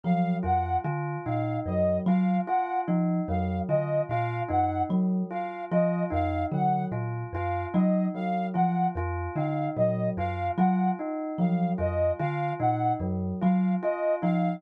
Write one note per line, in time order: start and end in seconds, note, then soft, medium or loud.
0.04 0.37 F3 medium
0.04 0.36 F#3 medium
0.04 0.36 F5 medium
0.43 0.77 F2 medium
0.43 0.75 F4 medium
0.43 0.77 F#5 medium
0.84 1.17 D3 medium
0.84 1.17 F4 medium
1.26 1.59 A#2 medium
1.26 1.58 D#4 medium
1.26 1.58 F5 medium
1.66 1.98 F#2 medium
1.66 2.00 F#3 medium
1.66 1.98 D#5 medium
2.06 2.39 F#3 medium
2.06 2.41 F4 medium
2.06 2.39 F5 medium
2.47 2.80 F4 medium
2.47 2.79 F#5 medium
2.88 3.20 F3 medium
2.88 3.20 D#4 medium
3.28 3.61 F2 medium
3.28 3.61 F#3 medium
3.28 3.60 F5 medium
3.68 4.01 D3 medium
3.68 4.02 F4 medium
3.68 4.01 D#5 medium
4.09 4.42 A#2 medium
4.09 4.43 F4 medium
4.09 4.41 F5 medium
4.48 4.83 F#2 medium
4.48 4.81 D#4 medium
4.48 4.82 F#5 medium
4.89 5.22 F#3 medium
5.31 5.63 F4 medium
5.31 5.63 F5 medium
5.71 6.04 F3 medium
5.71 6.04 F4 medium
5.71 6.04 D#5 medium
6.10 6.44 F2 medium
6.10 6.43 D#4 medium
6.10 6.44 F5 medium
6.52 6.84 D3 medium
6.52 6.84 F#3 medium
6.52 6.85 F#5 medium
6.92 7.24 A#2 medium
6.92 7.24 F4 medium
7.33 7.65 F#2 medium
7.33 7.67 F4 medium
7.33 7.66 F5 medium
7.73 8.07 F#3 medium
7.73 8.06 D#4 medium
7.73 8.06 D#5 medium
8.14 8.47 F#3 medium
8.14 8.47 F5 medium
8.54 8.88 F3 medium
8.54 8.86 F4 medium
8.54 8.87 F#5 medium
8.95 9.28 F2 medium
8.95 9.30 F4 medium
9.36 9.68 D3 medium
9.36 9.68 D#4 medium
9.36 9.68 F5 medium
9.76 10.09 A#2 medium
9.76 10.09 F#3 medium
9.76 10.09 D#5 medium
10.17 10.49 F#2 medium
10.17 10.50 F4 medium
10.17 10.49 F5 medium
10.57 10.90 F#3 medium
10.57 10.91 F4 medium
10.57 10.90 F#5 medium
10.99 11.31 D#4 medium
11.38 11.71 F3 medium
11.38 11.72 F#3 medium
11.38 11.71 F5 medium
11.78 12.11 F2 medium
11.78 12.10 F4 medium
11.78 12.12 D#5 medium
12.19 12.52 D3 medium
12.19 12.52 F4 medium
12.19 12.52 F5 medium
12.60 12.92 A#2 medium
12.60 12.92 D#4 medium
12.60 12.93 F#5 medium
13.00 13.32 F#2 medium
13.00 13.32 F#3 medium
13.41 13.75 F#3 medium
13.41 13.74 F4 medium
13.41 13.73 F5 medium
13.82 14.15 F4 medium
13.82 14.15 D#5 medium
14.22 14.55 F3 medium
14.22 14.55 D#4 medium
14.22 14.55 F5 medium